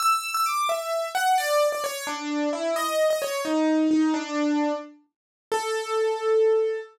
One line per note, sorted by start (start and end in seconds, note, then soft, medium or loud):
0.00 0.30 E6 loud
0.34 0.45 E6 loud
0.46 0.68 D6 medium
0.69 1.08 E5 medium
1.15 1.36 F#5 loud
1.38 1.67 D5 loud
1.72 1.83 D5 medium
1.84 2.04 C#5 loud
2.07 2.49 D4 loud
2.53 2.74 E4 medium
2.76 3.06 D#5 loud
3.10 3.21 D#5 loud
3.22 3.41 C#5 loud
3.45 3.87 D#4 medium
3.91 4.13 D#4 loud
4.14 4.73 D4 loud
5.52 6.77 A4 loud